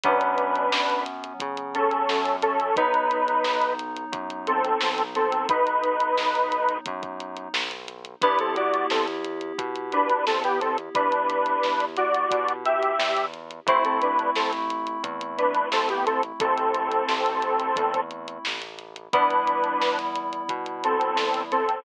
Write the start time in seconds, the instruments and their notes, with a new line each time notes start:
0.04 synth bass 1 F#2, electric piano 2 F#3 B3 C#4, lead 1 (square) D4 B4, kick, closed hi-hat
0.21 closed hi-hat
0.38 closed hi-hat
0.55 closed hi-hat
0.72 synth bass 1 F#2, snare
0.90 closed hi-hat
1.06 closed hi-hat
1.24 closed hi-hat
1.40 synth bass 1 C#3, kick, closed hi-hat
1.57 closed hi-hat
1.75 lead 1 (square) C#4 A4, closed hi-hat
1.91 closed hi-hat
2.09 synth bass 1 F#2, snare
2.25 closed hi-hat
2.42 lead 1 (square) C#4 A4, closed hi-hat
2.60 closed hi-hat
2.76 synth bass 1 B1, electric piano 2 F#3 B3 D#4, lead 1 (square) D#4 B4, kick, closed hi-hat
2.94 closed hi-hat
3.11 closed hi-hat
3.28 closed hi-hat
3.44 synth bass 1 B1, snare
3.62 closed hi-hat
3.79 closed hi-hat
3.96 closed hi-hat
4.12 synth bass 1 F#2, kick, closed hi-hat
4.30 closed hi-hat
4.47 lead 1 (square) C4 A4, closed hi-hat
4.64 closed hi-hat
4.81 synth bass 1 B1, snare
4.98 closed hi-hat
5.15 lead 1 (square) C4 A4, closed hi-hat
5.32 closed hi-hat
5.49 synth bass 1 B1, lead 1 (square) D#4 B4, kick, closed hi-hat
5.67 closed hi-hat
5.84 closed hi-hat
6.00 closed hi-hat
6.17 synth bass 1 B1, snare
6.35 closed hi-hat
6.52 closed hi-hat
6.69 closed hi-hat
6.86 synth bass 1 F#2, kick, closed hi-hat
7.03 kick, closed hi-hat
7.20 closed hi-hat
7.37 closed hi-hat
7.54 synth bass 1 B1, snare
7.71 closed hi-hat
7.88 closed hi-hat
8.05 closed hi-hat
8.22 synth bass 1 E2, electric piano 2 B3 E4 G4, lead 1 (square) D4 B4, kick, closed hi-hat
8.39 lead 1 (square) C4 A4, closed hi-hat
8.56 lead 1 (square) F#4 D5, closed hi-hat
8.74 closed hi-hat
8.90 synth bass 1 E2, lead 1 (square) C4 A4, snare
9.08 closed hi-hat
9.24 closed hi-hat
9.41 closed hi-hat
9.58 synth bass 1 B2, kick, closed hi-hat
9.76 closed hi-hat
9.92 lead 1 (square) D4 B4, closed hi-hat
10.10 closed hi-hat
10.26 synth bass 1 E2, lead 1 (square) C4 A4, snare
10.44 lead 1 (square) B3 G4, closed hi-hat
10.61 lead 1 (square) C4 A4, closed hi-hat
10.78 closed hi-hat
10.95 synth bass 1 E2, lead 1 (square) D4 B4, kick, closed hi-hat
11.12 closed hi-hat
11.30 closed hi-hat
11.46 closed hi-hat
11.63 synth bass 1 E2, snare
11.80 closed hi-hat
11.97 lead 1 (square) F#4 D5, closed hi-hat
12.14 closed hi-hat
12.31 synth bass 1 B2, kick, closed hi-hat
12.48 closed hi-hat
12.65 lead 1 (square) G4 E5, closed hi-hat
12.83 closed hi-hat
12.99 synth bass 1 E2, snare
13.17 closed hi-hat
13.34 closed hi-hat
13.51 closed hi-hat
13.66 synth bass 1 A1, electric piano 2 A3 C4 E4, lead 1 (square) E4 C5, kick, closed hi-hat
13.85 lead 1 (square) C4 A4, closed hi-hat
14.02 lead 1 (square) D4 B4, closed hi-hat
14.19 closed hi-hat
14.36 synth bass 1 A1, lead 1 (square) C4 A4, snare
14.53 closed hi-hat
14.70 closed hi-hat
14.87 closed hi-hat
15.04 synth bass 1 E2, kick, closed hi-hat
15.21 closed hi-hat
15.38 lead 1 (square) D4 B4, closed hi-hat
15.55 closed hi-hat
15.71 synth bass 1 A1, lead 1 (square) C4 A4, snare
15.89 lead 1 (square) B3 G4, closed hi-hat
16.06 lead 1 (square) C4 A4, closed hi-hat
16.23 closed hi-hat
16.40 synth bass 1 A1, lead 1 (square) C4 A4, kick, closed hi-hat
16.58 closed hi-hat
16.74 closed hi-hat
16.91 closed hi-hat
17.08 synth bass 1 A1, snare
17.26 closed hi-hat
17.42 closed hi-hat
17.60 closed hi-hat
17.76 synth bass 1 E2, kick, closed hi-hat
17.94 kick, closed hi-hat
18.11 closed hi-hat
18.28 closed hi-hat
18.45 synth bass 1 A1, snare
18.62 closed hi-hat
18.79 closed hi-hat
18.96 closed hi-hat
19.13 synth bass 1 E2, electric piano 2 G3 B3 E4, lead 1 (square) D4 B4, kick, closed hi-hat
19.30 closed hi-hat
19.47 closed hi-hat
19.64 closed hi-hat
19.82 synth bass 1 E2, snare
19.99 closed hi-hat
20.15 closed hi-hat
20.33 closed hi-hat
20.49 synth bass 1 B2, kick, closed hi-hat
20.66 closed hi-hat
20.84 lead 1 (square) C4 A4, closed hi-hat
21.01 closed hi-hat
21.16 synth bass 1 E2, snare
21.34 closed hi-hat
21.52 lead 1 (square) C4 A4, closed hi-hat
21.69 closed hi-hat